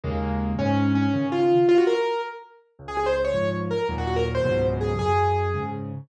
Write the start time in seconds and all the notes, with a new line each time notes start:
0.04 D#2 C#3 G#3 A#3
0.59 G#2 C#4
0.95 C#4
1.14 C#3 D#3
1.32 F4
1.69 F4
1.78 F#4
1.87 A#4
2.79 C#2
2.88 G#4
2.97 G#4
3.06 C5
3.25 C#5
3.34 G#2 F3
3.70 A#4
3.89 D#2 A#2 F#3
3.98 F#4
4.07 F#4
4.16 A#4
4.35 C5
4.44 C#2 G#2 B2 F#3
4.81 G#4
4.99 F#2 G#4
5.54 G#2 C#3